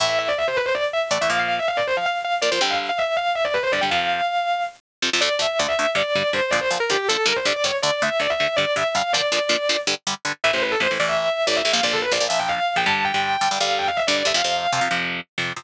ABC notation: X:1
M:7/8
L:1/16
Q:1/4=161
K:Am
V:1 name="Distortion Guitar"
e e e d e c B c d z e z d e | f f f e f d c f f z f z d c | g f z f e2 f2 e d B c d g | f8 z6 |
[K:Dm] d2 e2 d e3 d2 d2 c2 | d c z B G2 A2 B c d d ^c z | d2 e2 d e3 d2 e2 f2 | d8 z6 |
[K:Am] e c B A c z d e e3 d e2 | f d A B d z e g f3 g a2 | g6 f2 g f e d d e | f6 z8 |]
V:2 name="Overdriven Guitar"
[A,,E,A,]12 [A,,E,A,] [A,,E,A,] | [_B,,F,_B,]12 [B,,F,B,] [B,,F,B,] | [G,,D,G,]12 [G,,D,G,] [G,,D,G,] | [F,,C,F,]12 [F,,C,F,] [F,,C,F,] |
[K:Dm] [D,,D,A,]2 [D,,D,A,]2 [D,,D,A,]2 [D,,D,A,]2 [G,,D,G,]2 [G,,D,G,]2 [G,,D,G,]2 | [B,,D,F,]2 [B,,D,F,]2 [B,,D,F,]2 [B,,D,F,]2 [G,,D,G,]2 [G,,D,G,]2 [G,,D,G,]2 | [D,,D,A,]2 [D,,D,A,]2 [D,,D,A,]2 [D,,D,A,]2 [G,,D,G,]2 [G,,D,G,]2 [G,,D,G,]2 | [B,,D,F,]2 [B,,D,F,]2 [B,,D,F,]2 [B,,D,F,]2 [G,,D,G,]2 [G,,D,G,]2 [G,,D,G,]2 |
[K:Am] [A,,,A,,E,] [A,,,A,,E,]3 [A,,,A,,E,] [A,,,A,,E,] [A,,,A,,E,]5 [A,,,A,,E,]2 [A,,,A,,E,] | [_B,,,_B,,F,] [B,,,B,,F,]3 [B,,,B,,F,] [B,,,B,,F,] [B,,,B,,F,]5 [B,,,B,,F,] [G,,D,G,]2- | [G,,D,G,] [G,,D,G,]3 [G,,D,G,] [G,,D,G,] [G,,D,G,]5 [G,,D,G,]2 [G,,D,G,] | [F,,C,F,] [F,,C,F,]3 [F,,C,F,] [F,,C,F,] [F,,C,F,]5 [F,,C,F,]2 [F,,C,F,] |]